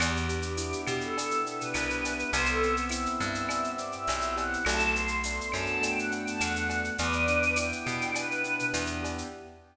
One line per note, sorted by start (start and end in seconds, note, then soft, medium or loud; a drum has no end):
0.00 0.74 E2 loud
0.00 1.18 B3 loud
0.00 0.27 G4 medium
0.00 cowbell loud
0.00 claves loud
0.00 shaker loud
0.17 shaker medium
0.29 1.46 D4 medium
0.29 0.88 G4 medium
0.29 shaker loud
0.42 shaker loud
0.57 1.74 E4 medium
0.57 tambourine loud
0.57 shaker loud
0.72 shaker medium
0.87 1.62 B2 medium
0.87 2.03 G4 medium
0.87 claves loud
0.87 shaker loud
1.01 1.37 A4 medium
1.01 shaker medium
1.17 2.29 B3 medium
1.17 cowbell loud
1.17 shaker loud
1.31 shaker medium
1.46 2.29 D4 medium
1.46 1.60 A4 medium
1.46 shaker medium
1.60 2.30 B4 medium
1.60 shaker medium
1.74 2.24 C2 medium
1.74 2.30 E4 medium
1.74 tambourine medium
1.74 cowbell medium
1.74 claves loud
1.74 shaker loud
1.90 shaker medium
2.03 2.31 G4 medium
2.03 cowbell medium
2.03 shaker loud
2.19 shaker medium
2.32 3.07 C2 loud
2.32 3.50 B3 loud
2.32 2.47 C5 loud
2.32 cowbell loud
2.32 shaker loud
2.46 2.75 A4 loud
2.46 shaker loud
2.63 3.78 C4 loud
2.63 shaker medium
2.77 shaker medium
2.89 4.08 E4 medium
2.89 3.16 E5 medium
2.89 tambourine medium
2.89 claves medium
2.89 shaker loud
3.06 shaker medium
3.20 3.95 G2 medium
3.20 4.36 G4 medium
3.20 3.70 E5 medium
3.20 shaker medium
3.35 shaker medium
3.49 4.61 B3 medium
3.49 cowbell loud
3.49 claves loud
3.49 shaker loud
3.64 shaker medium
3.78 4.62 C4 medium
3.78 3.92 D5 medium
3.78 shaker medium
3.92 4.34 E5 loud
3.92 shaker medium
4.07 4.57 B1 medium
4.07 4.64 E4 medium
4.07 tambourine medium
4.07 cowbell loud
4.07 shaker loud
4.21 shaker medium
4.36 4.64 G4 medium
4.36 4.64 F#5 medium
4.36 cowbell loud
4.36 shaker medium
4.53 shaker medium
4.65 5.40 B1 loud
4.65 5.81 A3 loud
4.65 4.91 A5 loud
4.65 cowbell loud
4.65 claves loud
4.65 shaker loud
4.80 shaker medium
4.95 6.10 B3 medium
4.95 5.51 C6 medium
4.95 shaker loud
5.08 shaker medium
5.24 6.40 D4 medium
5.24 tambourine loud
5.24 shaker loud
5.41 shaker medium
5.52 6.28 F#2 medium
5.52 6.68 F#4 medium
5.52 5.81 A5 medium
5.52 claves loud
5.52 shaker medium
5.66 shaker medium
5.81 6.92 A3 medium
5.81 5.96 G5 medium
5.81 cowbell medium
5.81 shaker loud
5.97 6.11 F#5 medium
5.97 shaker medium
6.11 6.94 B3 medium
6.11 6.25 G5 medium
6.11 shaker medium
6.26 6.40 A5 medium
6.26 shaker medium
6.40 6.90 E2 medium
6.40 6.96 D4 medium
6.40 6.91 F#5 medium
6.40 tambourine medium
6.40 cowbell medium
6.40 claves loud
6.40 shaker loud
6.56 shaker medium
6.69 6.97 F#4 medium
6.69 cowbell loud
6.69 shaker medium
6.84 shaker medium
6.98 7.73 E2 loud
6.98 8.15 B3 loud
6.98 7.54 B4 loud
6.98 7.54 D5 loud
6.98 cowbell loud
6.98 shaker loud
7.12 shaker medium
7.27 8.44 D4 medium
7.27 shaker medium
7.43 shaker medium
7.56 8.72 E4 medium
7.56 8.10 G5 medium
7.56 tambourine loud
7.56 claves loud
7.56 shaker loud
7.72 shaker medium
7.86 8.61 B2 medium
7.86 9.02 G4 medium
7.86 shaker medium
8.01 shaker medium
8.15 9.26 B3 medium
8.15 8.66 B4 loud
8.15 cowbell loud
8.15 claves loud
8.15 shaker loud
8.31 shaker medium
8.44 9.28 D4 medium
8.44 shaker medium
8.59 shaker medium
8.73 9.23 E2 loud
8.73 9.28 E4 medium
8.73 tambourine medium
8.73 cowbell medium
8.73 shaker loud
8.86 shaker medium
9.03 9.30 G4 medium
9.03 cowbell medium
9.03 shaker medium
9.18 shaker medium